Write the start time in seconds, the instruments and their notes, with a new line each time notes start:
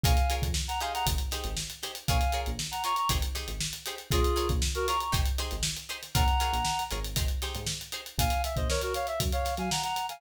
0.03 synth bass 1 A#1, acoustic guitar (steel) F4 G#4 A#4 C#5, clarinet F5 G#5, kick, closed hi-hat
0.17 closed hi-hat
0.30 acoustic guitar (steel) F4 G#4 A#4 C#5, closed hi-hat
0.42 synth bass 1 F2, kick, closed hi-hat
0.54 snare
0.68 clarinet F#5 A#5, snare, closed hi-hat
0.81 acoustic guitar (steel) D#4 G4 G#4 C5, clarinet F5 G#5, closed hi-hat
0.94 clarinet F#5 A#5, closed hi-hat
1.06 synth bass 1 G#1, kick, closed hi-hat
1.18 closed hi-hat
1.31 acoustic guitar (steel) D#4 G4 G#4 C5, snare, closed hi-hat
1.44 synth bass 1 G#1, closed hi-hat
1.57 snare
1.70 closed hi-hat
1.82 acoustic guitar (steel) D#4 G4 G#4 C5, snare, closed hi-hat
1.95 closed hi-hat
2.08 synth bass 1 A#1, acoustic guitar (steel) F4 G#4 A#4 C#5, clarinet F5 G#5, kick, closed hi-hat
2.21 closed hi-hat
2.32 acoustic guitar (steel) F4 G#4 A#4 C#5, closed hi-hat
2.46 synth bass 1 A#1, closed hi-hat
2.59 snare
2.71 clarinet F#5 A#5, closed hi-hat
2.84 acoustic guitar (steel) F4 G#4 A#4 C#5, clarinet A#5 C#6, closed hi-hat
2.96 clarinet A#5 C#6, closed hi-hat
3.09 synth bass 1 G#1, acoustic guitar (steel) D#4 G4 G#4 C5, kick, closed hi-hat
3.22 closed hi-hat
3.35 acoustic guitar (steel) D#4 G4 G#4 C5, snare, closed hi-hat
3.48 synth bass 1 G#1, closed hi-hat
3.60 snare
3.73 closed hi-hat
3.86 acoustic guitar (steel) D#4 G4 G#4 C5, closed hi-hat
3.98 closed hi-hat
4.11 synth bass 1 A#1, acoustic guitar (steel) F4 G#4 A#4 C#5, clarinet F4 G#4, kick, closed hi-hat
4.24 closed hi-hat
4.36 acoustic guitar (steel) F4 G#4 A#4 C#5, closed hi-hat
4.49 synth bass 1 A#1, kick, closed hi-hat
4.62 snare
4.75 clarinet F#4 A#4, closed hi-hat
4.87 acoustic guitar (steel) F4 G#4 A#4 C#5, clarinet A#5 C#6, snare, closed hi-hat
5.00 clarinet A#5 C#6, closed hi-hat
5.12 synth bass 1 G#1, acoustic guitar (steel) D#4 G4 G#4 C5, kick, closed hi-hat
5.26 closed hi-hat
5.38 acoustic guitar (steel) D#4 G4 G#4 C5, snare, closed hi-hat
5.51 synth bass 1 G#1, closed hi-hat
5.63 snare
5.77 closed hi-hat
5.89 acoustic guitar (steel) D#4 G4 G#4 C5, closed hi-hat
6.03 snare, closed hi-hat
6.15 synth bass 1 A#1, acoustic guitar (steel) F4 G#4 A#4 C#5, clarinet F#5 A#5, kick, closed hi-hat
6.28 closed hi-hat
6.39 acoustic guitar (steel) F4 G#4 A#4 C#5, snare, closed hi-hat
6.53 synth bass 1 A#1, closed hi-hat
6.65 snare
6.79 closed hi-hat
6.91 synth bass 1 G#1, acoustic guitar (steel) F4 G#4 A#4 C#5, closed hi-hat
7.04 closed hi-hat
7.16 acoustic guitar (steel) D#4 G4 G#4 C5, kick, closed hi-hat
7.28 closed hi-hat
7.42 acoustic guitar (steel) D#4 G4 G#4 C5, snare, closed hi-hat
7.55 synth bass 1 G#2, closed hi-hat
7.67 snare
7.81 closed hi-hat
7.92 acoustic guitar (steel) D#4 G4 G#4 C5, closed hi-hat
8.06 closed hi-hat
8.18 synth bass 1 A#1, clarinet F5 G#5, kick, closed hi-hat
8.30 closed hi-hat
8.44 clarinet E5, closed hi-hat
8.56 synth bass 1 A#1, clarinet C5 D#5, kick, closed hi-hat
8.69 clarinet A#4 C#5, snare
8.81 clarinet F#4 A#4, closed hi-hat
8.94 clarinet C#5 F5, snare, closed hi-hat
9.07 clarinet E5, closed hi-hat
9.20 synth bass 1 F#2, kick, closed hi-hat
9.32 clarinet C#5 F5, closed hi-hat
9.45 snare, closed hi-hat
9.57 synth bass 1 F#3, clarinet F5 G#5, snare, closed hi-hat
9.71 clarinet F#5 A#5, snare
9.83 clarinet F#5 A#5, closed hi-hat
9.96 snare, closed hi-hat
10.09 clarinet F5 G#5, snare, closed hi-hat